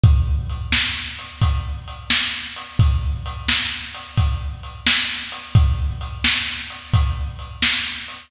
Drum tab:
HH |x-x--xx-x--x|x-x--xx-x--x|x-x--xx-x--x|
SD |---o-----o--|---o-----o--|---o-----o--|
BD |o-----o-----|o-----o-----|o-----o-----|